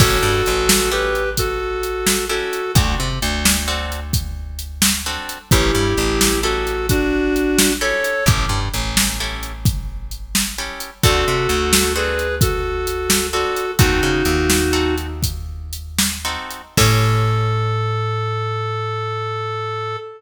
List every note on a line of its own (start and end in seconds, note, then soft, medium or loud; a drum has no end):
0.00 0.18 A1 medium
0.00 0.32 C#4 loud
0.00 0.32 E4 medium
0.00 0.90 F#4 medium
0.00 0.32 G4 loud
0.00 0.32 A4 medium
0.00 0.90 A4 medium
0.00 kick loud
0.00 crash loud
0.23 0.42 G2 medium
0.46 2.43 A1 medium
0.46 closed hi-hat medium
0.69 snare loud
0.92 1.24 C#4 medium
0.92 1.24 E4 medium
0.92 1.24 G4 medium
0.92 1.29 G4 medium
0.92 1.24 A4 medium
0.92 1.29 B4 medium
1.15 closed hi-hat medium
1.37 2.25 F#4 medium
1.37 2.25 A4 medium
1.37 kick medium
1.37 closed hi-hat loud
1.83 closed hi-hat medium
2.07 snare loud
2.29 2.62 C#4 medium
2.29 2.62 E4 medium
2.29 2.72 F#4 medium
2.29 2.62 G4 medium
2.29 2.62 A4 medium
2.29 2.72 A4 medium
2.53 closed hi-hat medium
2.75 2.95 D2 medium
2.75 3.09 C4 loud
2.75 3.09 D4 loud
2.75 3.09 F#4 medium
2.75 3.09 A4 loud
2.75 kick loud
2.75 closed hi-hat loud
3.00 3.19 C3 medium
3.22 5.18 D2 medium
3.22 closed hi-hat medium
3.45 snare loud
3.68 4.00 C4 medium
3.68 4.00 D4 medium
3.68 4.00 F#4 loud
3.68 4.00 A4 medium
3.92 closed hi-hat medium
4.13 kick loud
4.13 closed hi-hat loud
4.59 closed hi-hat medium
4.82 snare loud
5.06 5.38 C4 medium
5.06 5.38 D4 medium
5.06 5.38 F#4 medium
5.06 5.38 A4 medium
5.29 closed hi-hat medium
5.51 5.71 A1 medium
5.51 5.85 C#4 medium
5.51 6.40 E4 medium
5.51 5.85 E4 loud
5.51 6.40 G4 medium
5.51 5.85 G4 loud
5.51 5.85 A4 loud
5.51 kick loud
5.51 closed hi-hat loud
5.75 5.94 G2 medium
5.97 7.93 A1 medium
5.97 closed hi-hat medium
6.21 snare loud
6.43 6.75 C#4 medium
6.43 6.75 E4 loud
6.43 6.86 F#4 medium
6.43 6.75 G4 medium
6.43 6.75 A4 medium
6.43 6.86 A4 medium
6.67 closed hi-hat medium
6.89 7.72 D4 medium
6.89 7.72 F#4 medium
6.89 kick loud
6.89 closed hi-hat loud
7.36 closed hi-hat medium
7.59 snare loud
7.81 8.13 C#4 medium
7.81 8.13 E4 medium
7.81 8.13 G4 medium
7.81 8.13 A4 medium
7.81 8.24 A4 medium
7.81 8.24 C#5 medium
8.04 closed hi-hat medium
8.26 8.46 A1 medium
8.26 8.60 C#4 medium
8.26 8.60 E4 medium
8.26 8.60 G4 loud
8.26 8.60 A4 medium
8.26 kick loud
8.26 closed hi-hat loud
8.49 8.69 G2 medium
8.74 10.69 A1 medium
8.74 closed hi-hat medium
8.97 snare loud
9.20 9.52 C#4 medium
9.20 9.52 E4 medium
9.20 9.52 G4 medium
9.20 9.52 A4 medium
9.43 closed hi-hat medium
9.65 kick loud
9.65 closed hi-hat loud
10.11 closed hi-hat medium
10.35 snare loud
10.58 10.91 C#4 medium
10.58 10.91 E4 medium
10.58 10.91 G4 medium
10.58 10.91 A4 medium
10.80 closed hi-hat medium
11.03 11.25 D2 medium
11.03 11.36 C4 loud
11.03 11.36 D4 loud
11.03 11.36 F#4 loud
11.03 11.93 F#4 medium
11.03 11.36 A4 medium
11.03 11.93 A4 medium
11.03 kick loud
11.03 closed hi-hat loud
11.28 11.47 C3 medium
11.49 13.45 D2 medium
11.49 closed hi-hat medium
11.73 snare loud
11.96 12.28 C4 medium
11.96 12.28 D4 medium
11.96 12.28 F#4 medium
11.96 12.35 G#4 medium
11.96 12.28 A4 medium
11.96 12.35 B4 medium
12.19 closed hi-hat medium
12.41 13.27 F#4 medium
12.41 13.27 A4 medium
12.41 kick loud
12.41 closed hi-hat loud
12.87 closed hi-hat loud
13.10 snare loud
13.33 13.65 C4 medium
13.33 13.65 D4 medium
13.33 13.65 F#4 medium
13.33 13.71 F#4 medium
13.33 13.65 A4 medium
13.33 13.71 A4 medium
13.56 closed hi-hat medium
13.79 14.01 D#2 medium
13.79 14.11 C4 loud
13.79 14.11 D#4 loud
13.79 14.95 D#4 medium
13.79 14.11 F#4 loud
13.79 14.95 F#4 medium
13.79 14.11 A4 loud
13.79 kick loud
13.79 closed hi-hat loud
14.03 14.23 C#3 medium
14.25 16.37 D#2 medium
14.25 closed hi-hat medium
14.50 snare loud
14.73 15.07 C4 medium
14.73 15.07 D#4 medium
14.73 15.07 F#4 medium
14.73 15.07 A4 loud
14.98 closed hi-hat medium
15.23 kick medium
15.23 closed hi-hat loud
15.73 closed hi-hat medium
15.99 snare loud
16.25 16.62 C4 medium
16.25 16.62 D#4 medium
16.25 16.62 F#4 medium
16.25 16.62 A4 medium
16.51 closed hi-hat medium
16.77 19.96 A2 loud
16.77 19.97 C#4 loud
16.77 19.97 E4 medium
16.77 19.97 G4 loud
16.77 19.96 A4 loud
16.77 19.97 A4 loud
16.77 kick loud
16.77 crash loud